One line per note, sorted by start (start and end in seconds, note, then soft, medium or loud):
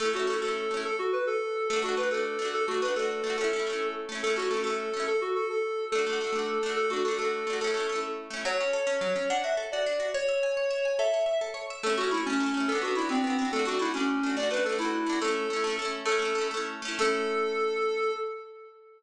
0.00 0.12 A3 medium
0.00 0.12 C#4 medium
0.00 0.12 A4 medium
0.05 0.12 E4 medium
0.13 0.26 A3 medium
0.13 0.26 C#4 medium
0.13 0.27 F#4 medium
0.20 0.26 E4 medium
0.27 0.40 A3 medium
0.27 0.40 C#4 medium
0.27 0.40 A4 medium
0.33 0.40 E4 medium
0.42 0.68 A3 medium
0.42 0.68 C#4 medium
0.42 0.80 A4 medium
0.48 0.68 E4 medium
0.71 0.84 A3 soft
0.71 0.84 C#4 medium
0.77 0.84 E4 medium
0.85 0.96 A4 medium
0.99 1.12 F#4 medium
1.13 1.25 B4 medium
1.27 1.68 A4 medium
1.69 1.82 A3 medium
1.69 1.81 A4 medium
1.73 1.83 D4 medium
1.73 1.83 F#4 medium
1.82 1.95 A3 medium
1.82 1.95 D4 medium
1.82 1.95 F#4 medium
1.89 1.95 F#4 medium
1.97 2.10 A3 medium
1.97 2.10 D4 medium
1.97 2.09 B4 medium
2.03 2.10 F#4 medium
2.11 2.37 A3 medium
2.11 2.37 D4 medium
2.11 2.48 A4 medium
2.17 2.37 F#4 medium
2.39 2.66 A3 medium
2.39 2.66 D4 medium
2.45 2.66 F#4 medium
2.54 2.65 A4 medium
2.68 2.81 A3 medium
2.68 2.81 D4 medium
2.68 2.81 F#4 medium
2.74 2.81 F#4 medium
2.82 2.95 A3 medium
2.82 2.95 D4 medium
2.82 2.94 B4 medium
2.88 2.95 F#4 medium
2.96 3.22 A3 medium
2.96 3.22 D4 medium
2.96 3.36 A4 medium
3.02 3.22 F#4 medium
3.24 3.37 A3 medium
3.24 3.37 D4 medium
3.30 3.37 F#4 medium
3.38 3.51 A3 medium
3.38 3.51 C#4 medium
3.38 3.88 A4 medium
3.44 3.51 E4 medium
3.53 3.66 A3 medium
3.53 3.66 C#4 medium
3.59 3.66 E4 medium
3.67 4.06 A3 medium
3.67 4.06 C#4 medium
3.73 4.06 E4 medium
4.09 4.22 A3 medium
4.09 4.22 C#4 medium
4.15 4.22 E4 medium
4.23 4.36 A3 medium
4.23 4.35 A4 medium
4.27 4.37 C#4 medium
4.27 4.37 E4 medium
4.36 4.49 A3 medium
4.36 4.49 C#4 medium
4.36 4.49 F#4 medium
4.42 4.49 E4 medium
4.51 4.63 A3 medium
4.51 4.64 C#4 medium
4.51 4.63 A4 medium
4.57 4.64 E4 medium
4.64 4.90 A3 medium
4.64 4.90 C#4 medium
4.64 5.04 A4 medium
4.70 4.90 E4 medium
4.93 5.06 A3 soft
4.93 5.06 C#4 medium
5.00 5.06 E4 medium
5.07 5.20 A4 medium
5.21 5.35 F#4 medium
5.35 5.47 A4 medium
5.49 5.85 A4 medium
5.92 6.05 A3 medium
5.92 6.05 D4 medium
5.92 6.72 A4 medium
5.98 6.05 F#4 medium
6.07 6.19 A3 medium
6.07 6.19 D4 medium
6.13 6.19 F#4 medium
6.21 6.32 A3 medium
6.21 6.34 D4 medium
6.27 6.34 F#4 medium
6.32 6.58 A3 medium
6.32 6.58 D4 medium
6.39 6.58 F#4 medium
6.63 6.90 A3 medium
6.63 6.90 D4 medium
6.69 6.90 F#4 medium
6.76 6.90 A4 medium
6.90 7.03 A3 medium
6.90 7.03 D4 medium
6.90 7.04 F#4 medium
6.96 7.03 F#4 medium
7.04 7.18 A3 medium
7.04 7.18 D4 medium
7.04 7.16 A4 medium
7.11 7.18 F#4 medium
7.18 7.44 A3 medium
7.18 7.44 D4 medium
7.18 7.57 A4 medium
7.25 7.44 F#4 medium
7.47 7.60 A3 medium
7.47 7.60 D4 medium
7.53 7.60 F#4 medium
7.61 7.73 A3 medium
7.61 7.74 C#4 medium
7.61 8.00 A4 medium
7.67 7.74 E4 medium
7.74 7.87 A3 medium
7.74 7.87 C#4 medium
7.80 7.87 E4 medium
7.89 8.28 A3 medium
7.89 8.28 C#4 medium
7.96 8.28 E4 medium
8.30 8.43 A3 medium
8.30 8.43 C#4 medium
8.37 8.43 E4 medium
8.45 8.58 F#3 loud
8.45 9.25 C#5 medium
8.60 8.73 C#4 medium
8.73 8.86 A4 medium
8.87 8.99 C#4 medium
9.01 9.14 F#3 medium
9.16 9.28 C#4 medium
9.30 9.43 D4 loud
9.30 9.43 F#5 medium
9.44 9.56 F#4 medium
9.44 9.56 E5 medium
9.57 9.70 A4 medium
9.72 9.86 F#4 medium
9.72 10.09 D5 medium
9.86 9.99 D4 medium
10.00 10.12 F#4 medium
10.14 10.97 C#5 medium
10.14 10.27 C#5 loud
10.29 10.41 E5 medium
10.43 10.56 G#5 medium
10.57 10.70 C#5 medium
10.71 10.83 E5 medium
10.85 10.98 G#5 medium
10.99 11.12 A4 loud
10.99 11.38 E5 medium
11.14 11.26 C#5 medium
11.26 11.39 E5 medium
11.41 11.54 A4 medium
11.54 11.67 C#5 medium
11.70 11.83 E5 medium
11.83 11.96 A3 medium
11.83 11.96 C#4 medium
11.83 11.95 A4 medium
11.90 11.96 E4 medium
11.97 12.10 A3 medium
11.97 12.10 C#4 medium
11.97 12.09 F#4 medium
12.04 12.10 E4 medium
12.11 12.24 A3 medium
12.11 12.24 C#4 medium
12.11 12.24 E4 medium
12.17 12.24 E4 medium
12.25 12.40 A3 medium
12.25 12.65 C#4 medium
12.30 12.40 C#4 medium
12.30 12.40 E4 medium
12.40 12.53 A3 medium
12.40 12.53 C#4 medium
12.46 12.53 E4 medium
12.54 12.67 A3 medium
12.54 12.67 C#4 medium
12.60 12.67 E4 medium
12.68 12.81 B3 medium
12.68 12.80 A4 medium
12.72 12.82 D4 medium
12.72 12.82 F#4 medium
12.82 12.94 B3 medium
12.82 12.94 D4 medium
12.82 12.95 F#4 medium
12.88 12.94 F#4 medium
12.95 13.08 B3 medium
12.95 13.08 D4 medium
12.95 13.09 E4 medium
13.02 13.08 F#4 medium
13.09 13.22 B3 medium
13.09 13.45 C4 medium
13.09 13.22 D4 medium
13.15 13.22 F#4 medium
13.24 13.37 B3 medium
13.24 13.37 D4 medium
13.30 13.37 F#4 medium
13.39 13.52 B3 medium
13.39 13.52 D4 medium
13.45 13.52 F#4 medium
13.52 13.65 A3 medium
13.52 13.66 D4 medium
13.52 13.64 A4 medium
13.59 13.66 F#4 medium
13.65 13.78 A3 medium
13.65 13.78 D4 medium
13.65 13.80 F#4 medium
13.72 13.78 F#4 medium
13.79 13.92 A3 medium
13.79 13.92 D4 medium
13.79 13.93 E4 medium
13.85 13.92 F#4 medium
13.94 14.20 A3 medium
13.94 14.30 C#4 medium
13.94 14.20 D4 medium
14.00 14.20 F#4 medium
14.23 14.36 A3 medium
14.23 14.36 D4 medium
14.30 14.36 F#4 medium
14.37 14.50 A3 medium
14.37 14.50 D4 medium
14.37 14.48 D5 medium
14.43 14.50 F#4 medium
14.51 14.63 A3 medium
14.51 14.63 D4 medium
14.51 14.63 B4 medium
14.57 14.63 F#4 medium
14.65 14.78 A3 medium
14.65 14.78 A4 medium
14.69 14.79 D4 medium
14.69 14.79 F#4 medium
14.78 15.04 A3 medium
14.78 15.04 D4 medium
14.78 15.19 E4 medium
14.85 15.04 F#4 medium
15.06 15.19 A3 medium
15.06 15.19 D4 medium
15.13 15.19 F#4 medium
15.21 15.47 A3 medium
15.21 15.47 C#4 medium
15.21 15.76 A4 medium
15.28 15.47 E4 medium
15.50 15.63 A3 medium
15.50 15.63 C#4 medium
15.56 15.63 E4 medium
15.64 15.77 A3 medium
15.64 15.77 C#4 medium
15.70 15.77 E4 medium
15.79 16.05 A3 medium
15.79 16.05 C#4 medium
15.85 16.05 E4 medium
16.05 16.18 A3 medium
16.05 16.19 C#4 medium
16.05 16.47 A4 medium
16.12 16.19 E4 medium
16.19 16.33 A3 medium
16.19 16.33 C#4 medium
16.25 16.33 E4 medium
16.35 16.49 A3 medium
16.35 16.49 C#4 medium
16.41 16.49 E4 medium
16.51 16.81 A3 medium
16.51 16.81 C#4 medium
16.57 16.81 E4 medium
16.82 16.98 A3 medium
16.82 16.98 C#4 medium
16.88 16.98 E4 medium
16.99 18.10 A3 loud
16.99 18.10 C#4 loud
16.99 18.11 A4 loud
17.05 18.10 E4 loud